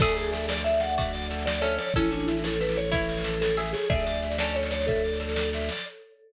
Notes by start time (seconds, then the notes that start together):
0.00 D2 G#4 A4 E5, kick, snare, crash
0.09 snare
0.16 G#4 D5, snare
0.24 snare
0.32 A4 E5, snare
0.41 snare
0.48 D5, snare
0.57 snare
0.64 A4 E5, snare
0.74 snare
0.80 D5 F#5, snare
0.89 snare
0.97 F#4 D5 E5, kick, snare
1.05 snare
1.13 D5, snare
1.22 snare
1.31 A4, snare
1.39 snare
1.46 D5, snare
1.55 snare
1.61 C#4 A4 C#5 E5, snare
1.71 snare
1.78 C#5 D5, snare
1.87 snare
1.94 A1 C#4 E4 A4, kick, snare
2.04 snare
2.11 D4 C#5, snare
2.20 snare
2.26 E4 E5, snare
2.37 snare
2.44 A4 C#5, snare
2.53 snare
2.60 A4 B4, snare
2.69 snare
2.76 C#5, snare
2.85 snare
2.92 E4 C#5 E5, kick, snare
3.01 snare
3.09 C#5, snare
3.17 snare
3.24 A4, snare
3.33 snare
3.41 A4 C#5, snare
3.49 snare
3.57 G#4 E5, snare
3.65 snare
3.73 G#4 C#5, snare
3.82 snare
3.90 D2 G#4 A4 D5 E5, kick, snare
3.99 snare
4.06 D5, snare
4.14 snare
4.22 E5, snare
4.31 snare
4.38 C#4 A4 D5, snare
4.48 snare
4.55 A4 C#5, snare
4.63 snare
4.71 C#5 D5, snare
4.81 snare
4.87 A4 E5, kick, snare
4.96 snare
5.04 D5, snare
5.13 snare
5.20 A4, snare
5.29 snare
5.35 D5, snare
5.45 snare
5.53 E5, snare
5.61 snare
5.69 D5, snare
5.77 snare